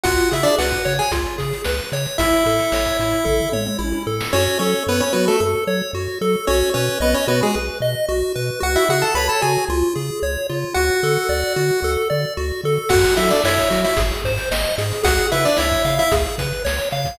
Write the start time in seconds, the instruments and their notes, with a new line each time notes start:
0.03 synth bass 1 C#2, lead 1 (square) F4 F#4 F#5, kick, closed hi-hat
0.18 closed hi-hat
0.31 synth bass 1 C#3, lead 1 (square) E4 G#4 E5, closed hi-hat
0.43 lead 1 (square) D4 D5, closed hi-hat
0.58 synth bass 1 C#2, lead 1 (square) F#4 B4 F#5, snare
0.72 kick, closed hi-hat
0.85 synth bass 1 C#3, lead 1 (square) C#5, closed hi-hat
0.99 lead 1 (square) G#4 G#5, closed hi-hat
1.11 synth bass 1 C#2, lead 1 (square) F4, kick, closed hi-hat
1.25 closed hi-hat
1.38 synth bass 1 C#3, lead 1 (square) G#4, kick, closed hi-hat
1.53 closed hi-hat
1.64 synth bass 1 C#2, lead 1 (square) B4, snare
1.79 closed hi-hat
1.92 synth bass 1 C#3, lead 1 (square) C#5, closed hi-hat
2.06 closed hi-hat
2.18 synth bass 1 A1, lead 1 (square) E4 E5, kick, closed hi-hat
2.32 closed hi-hat
2.46 synth bass 1 A2, lead 1 (square) A4, closed hi-hat
2.59 closed hi-hat
2.72 synth bass 1 A1, lead 1 (square) C#5, snare
2.85 kick, closed hi-hat
2.99 synth bass 1 A2, lead 1 (square) E4, closed hi-hat
3.11 closed hi-hat
3.25 synth bass 1 A1, lead 1 (square) A4, kick, floor tom
3.40 floor tom
3.52 synth bass 1 A2, lead 1 (square) C#5, mid tom
3.66 mid tom
3.79 synth bass 1 A1, lead 1 (square) E4, high tom
3.92 high tom
4.07 synth bass 1 A2, lead 1 (square) A4
4.20 snare
4.33 synth bass 1 F#2, lead 1 (square) C#4 F#4 C#5
4.59 synth bass 1 F#3, lead 1 (square) C#4 A4 C#5
4.87 synth bass 1 F#2, lead 1 (square) B3 B4 C#5
5.00 lead 1 (square) C#4 C#5
5.13 synth bass 1 F#3, lead 1 (square) B3 F#4 B4
5.28 lead 1 (square) A3 A4
5.40 synth bass 1 F#2, lead 1 (square) A4
5.67 synth bass 1 F#3, lead 1 (square) C#5
5.93 synth bass 1 F#2, lead 1 (square) F#4
6.21 synth bass 1 F#3, lead 1 (square) A4
6.47 synth bass 1 B1, lead 1 (square) C#4 F#4 C#5
6.74 synth bass 1 B2, lead 1 (square) C#4 B4 C#5
7.00 synth bass 1 B1, lead 1 (square) B3 B4 D#5
7.14 lead 1 (square) C#4 C#5
7.27 synth bass 1 B2, lead 1 (square) B3 F#4 B4
7.43 lead 1 (square) G#3 G#4
7.54 synth bass 1 B1, lead 1 (square) B4
7.80 synth bass 1 B2, lead 1 (square) D#5
8.08 synth bass 1 B1, lead 1 (square) F#4
8.35 synth bass 1 B2, lead 1 (square) B4
8.60 synth bass 1 C#2, lead 1 (square) F#4 F#5
8.76 lead 1 (square) E4 E5
8.89 synth bass 1 C#3, lead 1 (square) F#4 G#4 F#5
9.02 lead 1 (square) A4 A5
9.15 synth bass 1 C#2, lead 1 (square) B4 C#5 B5
9.29 lead 1 (square) A4 A5
9.41 synth bass 1 C#3, lead 1 (square) F#4 G#4 G#5
9.69 synth bass 1 C#2, lead 1 (square) F4
9.95 synth bass 1 C#3, lead 1 (square) G#4
10.22 synth bass 1 C#2, lead 1 (square) C#5
10.49 synth bass 1 C#3, lead 1 (square) F4
10.74 synth bass 1 D2, lead 1 (square) F#4 F#5
11.03 synth bass 1 D3, lead 1 (square) A4
11.29 synth bass 1 D2, lead 1 (square) D5
11.56 synth bass 1 D3, lead 1 (square) F#4
11.82 synth bass 1 D2, lead 1 (square) A4
12.10 synth bass 1 D3, lead 1 (square) D5
12.37 synth bass 1 D2, lead 1 (square) F#4
12.64 synth bass 1 D3, lead 1 (square) A4
12.89 synth bass 1 F#2, lead 1 (square) F#4 F#5, kick, crash
13.04 closed hi-hat
13.16 synth bass 1 F#3, lead 1 (square) E4 A4 E5, closed hi-hat
13.30 lead 1 (square) D4 D5, closed hi-hat
13.44 synth bass 1 F#2, lead 1 (square) E4 C#5 E5, snare
13.58 kick, closed hi-hat
13.70 synth bass 1 F#3, lead 1 (square) F#4, closed hi-hat
13.84 lead 1 (square) E4 E5, closed hi-hat
13.97 synth bass 1 G#1, lead 1 (square) G#4, kick, closed hi-hat
14.12 closed hi-hat
14.24 synth bass 1 G#2, lead 1 (square) C5, kick, closed hi-hat
14.38 closed hi-hat
14.51 synth bass 1 G#1, lead 1 (square) D#5, snare
14.64 closed hi-hat
14.78 synth bass 1 G#2, lead 1 (square) G#4, closed hi-hat
14.92 closed hi-hat
15.03 synth bass 1 C#2, lead 1 (square) F#4 G#4 F#5, kick, closed hi-hat
15.18 closed hi-hat
15.32 synth bass 1 C#3, lead 1 (square) E4 B4 E5, closed hi-hat
15.45 lead 1 (square) D4 D5, closed hi-hat
15.57 synth bass 1 C#2, lead 1 (square) E4 C#5 E5, snare
15.71 kick, closed hi-hat
15.85 synth bass 1 C#3, lead 1 (square) F5, closed hi-hat
15.99 lead 1 (square) E4 E5, closed hi-hat
16.12 synth bass 1 C#2, lead 1 (square) G#4, kick, closed hi-hat
16.26 closed hi-hat
16.38 synth bass 1 C#3, lead 1 (square) B4, kick, closed hi-hat
16.53 closed hi-hat
16.65 synth bass 1 C#2, lead 1 (square) C#5, snare
16.78 closed hi-hat
16.91 synth bass 1 C#3, lead 1 (square) F5, closed hi-hat
17.05 kick, closed hi-hat